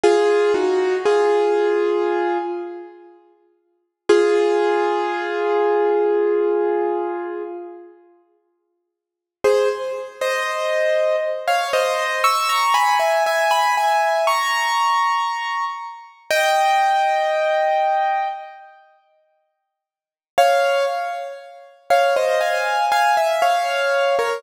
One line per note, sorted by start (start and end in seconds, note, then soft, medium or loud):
0.04 0.53 F4 loud
0.04 0.53 G#4 loud
0.54 0.96 D#4 medium
0.54 0.96 F#4 medium
1.06 2.38 F4 medium
1.06 2.38 G#4 medium
4.09 7.43 F4 medium
4.09 7.43 G#4 loud
9.44 9.69 G#4 medium
9.44 9.69 C5 medium
10.21 11.16 C5 medium
10.21 11.16 D#5 medium
11.48 11.72 C#5 medium
11.48 11.72 F5 medium
11.73 12.22 C5 medium
11.73 12.22 D#5 medium
12.24 12.48 C#6 medium
12.24 12.48 E6 medium
12.49 12.74 A#5 medium
12.49 12.74 C#6 medium
12.74 12.98 G#5 medium
12.74 12.98 B5 medium
13.00 13.24 E5 medium
13.00 13.24 G#5 medium
13.26 13.51 E5 medium
13.26 13.50 G#5 medium
13.51 13.75 G#5 medium
13.51 13.75 B5 medium
13.77 14.26 E5 medium
13.77 14.26 G#5 medium
14.27 15.65 A#5 medium
14.27 15.65 C#6 medium
16.31 18.28 D#5 medium
16.31 18.28 G5 loud
20.38 20.85 C#5 medium
20.38 20.85 F5 loud
21.90 22.15 C#5 medium
21.90 22.15 F5 medium
22.17 22.41 C5 medium
22.17 22.41 D#5 medium
22.41 22.85 F5 medium
22.41 22.85 G#5 medium
22.92 23.16 F5 medium
22.92 23.16 G#5 medium
23.17 23.41 E5 medium
23.42 24.16 C#5 medium
23.42 24.16 F5 medium
24.19 24.43 A#4 medium
24.19 24.43 C#5 medium